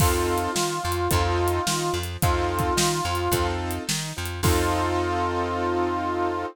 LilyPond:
<<
  \new Staff \with { instrumentName = "Harmonica" } { \time 4/4 \key f \major \tempo 4 = 108 f'1 | f'2~ f'8 r4. | f'1 | }
  \new Staff \with { instrumentName = "Acoustic Grand Piano" } { \time 4/4 \key f \major <c' ees' f' a'>4 ees'8 f8 <c' ees' f' a'>4 ees'8 f8 | <c' ees' f' a'>4 ees'8 f8 <c' ees' f' a'>4 ees'8 f8 | <c' ees' f' a'>1 | }
  \new Staff \with { instrumentName = "Electric Bass (finger)" } { \clef bass \time 4/4 \key f \major f,4 ees8 f,8 f,4 ees8 f,8 | f,4 ees8 f,8 f,4 ees8 f,8 | f,1 | }
  \new DrumStaff \with { instrumentName = "Drums" } \drummode { \time 4/4 \tuplet 3/2 { <cymc bd>8 r8 hh8 sn8 r8 hh8 <hh bd>8 r8 hh8 sn8 r8 hh8 } | \tuplet 3/2 { <hh bd>8 r8 <hh bd>8 sn8 r8 hh8 <hh bd>8 r8 hh8 sn8 r8 hh8 } | <cymc bd>4 r4 r4 r4 | }
>>